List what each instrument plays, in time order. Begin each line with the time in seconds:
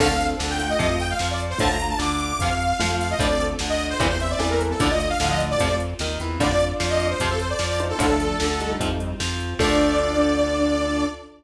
0.00 synth bass 1 D2, overdriven guitar D3 F3 A3, lead 1 (square) C4 A4, string ensemble 1 D4 F4 A4, lead 2 (sawtooth) F5, kick, crash
0.21 closed hi-hat
0.39 synth bass 1 D2, overdriven guitar D3, snare
0.50 lead 2 (sawtooth) G5
0.59 lead 1 (square) A3 F4, closed hi-hat
0.69 lead 2 (sawtooth) D#5
0.79 synth bass 1 F2, overdriven guitar C3 F3, string ensemble 1 C4 F4, lead 2 (sawtooth) D#5, kick, closed hi-hat
0.90 lead 2 (sawtooth) D#5
1.00 lead 2 (sawtooth) G5, closed hi-hat
1.10 lead 2 (sawtooth) F5
1.19 synth bass 1 F2, overdriven guitar F3, snare
1.30 lead 2 (sawtooth) D5
1.40 closed hi-hat
1.50 lead 2 (sawtooth) C5
1.58 synth bass 1 D2, overdriven guitar A2 D3 F3, lead 1 (square) A3 F4, string ensemble 1 A3 D4 F4, lead 2 (sawtooth) A5, kick, closed hi-hat
1.70 lead 2 (sawtooth) A#5
1.80 closed hi-hat
1.89 lead 2 (sawtooth) A5
1.99 synth bass 1 D2, overdriven guitar D3, lead 2 (sawtooth) D6, snare
2.20 lead 2 (sawtooth) D6, closed hi-hat
2.39 synth bass 1 F2, overdriven guitar C3 F3, string ensemble 1 C4 F4, lead 2 (sawtooth) F5, kick, closed hi-hat
2.61 closed hi-hat
2.79 synth bass 1 F2, overdriven guitar F3, lead 1 (square) A3 F4, snare
3.00 lead 2 (sawtooth) F5, closed hi-hat
3.10 lead 2 (sawtooth) D#5
3.19 synth bass 1 D2, overdriven guitar A2 D3 F3, string ensemble 1 A3 D4 F4, lead 1 (square) C4 A4, lead 2 (sawtooth) D5, kick, closed hi-hat
3.40 closed hi-hat
3.59 synth bass 1 D2, overdriven guitar D3, snare
3.69 lead 2 (sawtooth) D#5
3.79 closed hi-hat
3.90 lead 2 (sawtooth) C5
4.00 synth bass 1 E2, overdriven guitar G2 A#2 C3 E3, string ensemble 1 G3 A#3 C4 E4, lead 2 (sawtooth) C5, kick, closed hi-hat
4.09 lead 2 (sawtooth) C5
4.20 lead 2 (sawtooth) E5, closed hi-hat
4.30 lead 2 (sawtooth) D5
4.39 synth bass 1 E2, overdriven guitar E3, lead 1 (square) C4 A4, snare
4.50 lead 2 (sawtooth) A#4
4.61 closed hi-hat
4.71 lead 2 (sawtooth) A4
4.80 synth bass 1 D2, overdriven guitar A2 D3 F3, string ensemble 1 A3 D4 F4, lead 1 (square) A3 F4, lead 2 (sawtooth) D5, kick, closed hi-hat
4.90 lead 1 (square) A3 F4, lead 2 (sawtooth) D#5
5.00 closed hi-hat
5.09 lead 2 (sawtooth) F5
5.20 synth bass 1 D2, lead 1 (square) A2 F3, overdriven guitar D3, snare
5.30 lead 2 (sawtooth) D#5
5.39 lead 1 (square) A2 F3, closed hi-hat
5.50 lead 2 (sawtooth) D5
5.58 synth bass 1 F2, overdriven guitar C3 F3, lead 1 (square) A3 F4, string ensemble 1 C4 F4, kick, closed hi-hat
5.80 closed hi-hat
5.99 synth bass 1 D#2, overdriven guitar D#3, snare
6.20 synth bass 1 E2, overdriven guitar E3, closed hi-hat
6.40 synth bass 1 F2, overdriven guitar A2 D3 F3, string ensemble 1 A3 D4 F4, lead 1 (square) F4 D5, lead 2 (sawtooth) D5, kick, closed hi-hat
6.60 closed hi-hat
6.80 synth bass 1 F2, overdriven guitar F3, snare
6.90 lead 2 (sawtooth) D#5
7.00 closed hi-hat
7.10 lead 2 (sawtooth) C5
7.20 synth bass 1 F2, overdriven guitar C3 F3, string ensemble 1 C4 F4, lead 2 (sawtooth) C5, kick, closed hi-hat
7.30 lead 2 (sawtooth) A4
7.39 lead 2 (sawtooth) C5, closed hi-hat
7.50 lead 2 (sawtooth) D5
7.59 synth bass 1 F2, overdriven guitar F3, snare
7.70 lead 2 (sawtooth) D5
7.79 lead 1 (square) D#4 C5, closed hi-hat
7.89 lead 2 (sawtooth) A4
7.99 synth bass 1 D2, overdriven guitar A2 D3 F3, lead 1 (square) F3 D4, string ensemble 1 A3 D4 F4, lead 2 (sawtooth) A4, kick, closed hi-hat
8.20 closed hi-hat
8.40 synth bass 1 D2, overdriven guitar D3, snare
8.60 lead 1 (square) G3 D#4, closed hi-hat
8.80 synth bass 1 F2, overdriven guitar C3 F3, string ensemble 1 C4 F4, kick, closed hi-hat
9.00 closed hi-hat
9.20 synth bass 1 F2, overdriven guitar F3, snare
9.40 closed hi-hat
9.59 synth bass 1 D2, overdriven guitar D3 F3 A3, string ensemble 1 D4 F4 A4, lead 1 (square) D4, lead 2 (sawtooth) D5, kick, crash